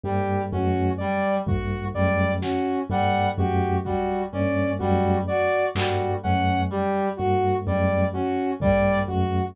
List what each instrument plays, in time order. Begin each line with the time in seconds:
0.04 tubular bells G2, clarinet G3, lead 2 (sawtooth) G4
0.52 tubular bells F#2, clarinet C#4, lead 2 (sawtooth) F#4
0.98 clarinet G3, lead 2 (sawtooth) D5
1.46 tubular bells G2, lead 2 (sawtooth) F#4, clarinet F#4, kick
1.94 tubular bells F#2, clarinet G3, lead 2 (sawtooth) D5
2.41 clarinet C#4, lead 2 (sawtooth) F#4, snare
2.90 tubular bells G2, clarinet G3, lead 2 (sawtooth) F#5
3.38 tubular bells F#2, clarinet F#4, lead 2 (sawtooth) G4
3.84 clarinet G3, lead 2 (sawtooth) F#4, kick
4.32 tubular bells G2, clarinet C#4, lead 2 (sawtooth) D5
4.79 tubular bells F#2, clarinet G3, lead 2 (sawtooth) F#4
5.27 clarinet F#4, lead 2 (sawtooth) D5
5.75 tubular bells G2, clarinet G3, lead 2 (sawtooth) F#4, clap
6.23 tubular bells F#2, clarinet C#4, lead 2 (sawtooth) F#5
6.70 clarinet G3, lead 2 (sawtooth) G4
7.17 tubular bells G2, lead 2 (sawtooth) F#4, clarinet F#4
7.67 tubular bells F#2, clarinet G3, lead 2 (sawtooth) D5
8.13 clarinet C#4, lead 2 (sawtooth) F#4
8.60 tubular bells G2, clarinet G3, lead 2 (sawtooth) D5, kick
9.07 tubular bells F#2, lead 2 (sawtooth) F#4, clarinet F#4